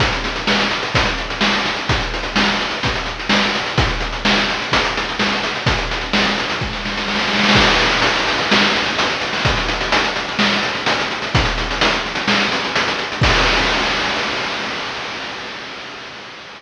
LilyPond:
\new DrumStaff \drummode { \time 4/4 \tempo 4 = 127 <hh bd>16 hh16 hh16 hh16 sn16 hh16 hh16 hh16 <hh bd>16 hh16 hh16 hh16 sn16 hh16 hh16 hh16 | <hh bd>16 hh16 hh16 hh16 sn16 hh16 hh16 hh16 <hh bd>16 hh16 hh16 hh16 sn16 hh16 hh16 hh16 | <hh bd>16 hh16 hh16 hh16 sn16 hh16 hh16 hh16 <hh bd>16 hh16 hh16 hh16 sn16 hh16 hh16 hh16 | <hh bd>16 hh16 hh16 hh16 sn16 hh16 hh16 hh16 <bd sn>16 sn16 sn16 sn16 sn32 sn32 sn32 sn32 sn32 sn32 sn32 sn32 |
<cymc bd>16 hh16 hh16 hh16 hh16 hh16 hh16 hh16 sn16 hh16 hh16 hh16 hh16 hh16 hh16 hho16 | <hh bd>16 hh16 hh16 hh16 hh16 hh16 hh16 hh16 sn16 hh16 hh16 hh16 hh16 hh16 hh16 hh16 | <hh bd>16 hh16 hh16 hh16 hh16 hh16 hh16 hh16 sn16 hh16 hh16 hh16 hh16 hh16 hh16 hh16 | <cymc bd>4 r4 r4 r4 | }